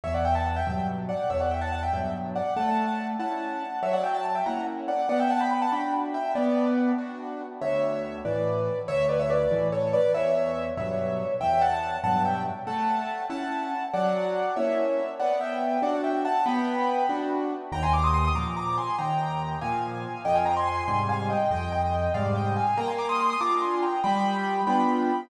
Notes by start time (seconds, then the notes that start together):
0.04 E2 C#5 E5
0.14 D5 F#5
0.25 E5 G5
0.35 F#5 A5
0.46 F#5 A5
0.56 E5 G5
0.67 G2 B2 F#3 E5 G5
1.09 D5 F#5
1.30 E2 C#5 E5
1.40 D5 F#5
1.51 E5 G5
1.61 F#5 A5
1.72 F#5 A5
1.83 E5 G5
1.93 G2 B2 F#3 E5 G5
2.35 D5 F#5
2.56 A3 F#5 A5
3.19 C#4 E4 F#5 A5
3.82 F#3 C#5 E5
3.93 D5 F#5
4.03 E5 G5
4.14 A5
4.25 A5
4.35 E5 G5
4.46 A#3 C#4 E4 F#5 A#5
4.88 D5 F#5
5.09 B3 D5 F#5
5.19 E5 G5
5.30 F#5 A5
5.40 G5 B5
5.51 G5 B5
5.61 F#5 A5
5.72 D4 F#4 G5 B5
6.14 E5 G5
6.35 B3 B4 D5
6.98 D4 F#4
7.61 D2 C#5 E5
8.25 A2 E3 B4 D5
8.88 D2 C#5 E5
9.09 B4 D5
9.19 C#5 E5
9.30 B4 D5
9.51 A2 E3
9.72 A4 C#5
9.93 B4 D5
10.14 E2 C#5 E5
10.77 G2 B2 F#3 C#5 E5
11.41 E2 E5 G5
11.61 F#5 A5
12.04 G2 B2 F#3 F#5 A5
12.25 E5 G5
12.67 A3 F#5 A5
13.30 C#4 E4 F#5 A5
13.93 F#3 D5 F#5
14.56 A#3 C#4 E4 C#5 E5
15.19 B3 D5 F#5
15.41 E5 G5
15.82 D4 F#4 D5 F#5
16.04 E5 G5
16.25 F#5 A5
16.46 B3 G5 B5
17.09 D4 F#4
17.72 D#2 G5 A#5
17.83 G#5 C6
17.93 A#5 D6
18.04 C6 D#6
18.14 C6 D#6
18.25 C6 D#6
18.35 A#2 F3 A#5 D6
18.56 A#5 D6
18.78 G#5 C6
18.98 D#2 G5 A#5
19.61 A#2 F3 F5 G#5
20.25 F2 D#5 G5
20.35 F5 G#5
20.46 G5 A#5
20.56 G#5 C6
20.67 G#5 C6
20.77 G#5 C6
20.88 G#2 C3 G3 G#5 C6
21.09 F5 G#5
21.30 D#5 G5
21.51 F2 D#5 G5
21.72 D#5 G5
22.14 G#2 C3 G3 D5 F5
22.35 D#5 G5
22.56 F5 G#5
22.77 A#3 G5 A#5
22.88 G#5 C6
22.98 A#5 D6
23.09 C6 D#6
23.19 C6 D#6
23.30 C6 D#6
23.40 D4 F4 A#5 D6
23.62 G#5 C6
23.82 G5 A#5
24.04 G3 G5 B5
24.67 B3 D4 F4 G5 B5